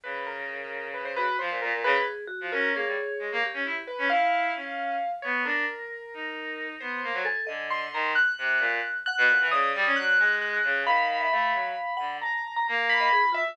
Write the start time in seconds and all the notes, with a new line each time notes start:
0.03 C#3 B4
0.27 A#4
0.94 B4
1.05 C5
1.16 F#4 B4
1.39 F3 C5
1.50 A#2
1.62 A#2 A#4
1.73 A#2
1.84 C#3 G#4 B4
2.27 F#4
2.41 F3
2.52 C#4 A#4
2.74 A#3 G#4 C#5
2.86 G3
3.19 G#3
3.32 A#3
3.43 G4
3.54 C#4
3.65 E4
3.87 B4
3.98 C#4
4.10 E4 F5
4.55 C#4
5.22 B3 C#5
5.44 D4 A#4
6.14 D#4
6.80 B3 C5
7.03 A#3
7.13 F#3
7.25 A4 G#5
7.47 D3 D#5
7.70 C6
7.93 D#3 A#5
8.15 F#6
8.38 C3
8.59 A#2
9.06 F#5 F#6
9.18 B2
9.28 A#2
9.40 E3
9.51 C#3 D5 D#6
9.75 G3
9.85 C#4
9.96 F#3 F#6
10.18 G#3 G#5
10.41 F#6
10.64 C#3
10.85 D#3 F5 B5
11.21 E5
11.32 A3 F5
11.53 F#3
11.97 D3 F#5
12.21 A5 A#5
12.56 A#5
12.68 A#3 A#5
12.89 B5
13.00 D#5
13.12 G#4
13.22 F4
13.32 F4 E5
13.48 F4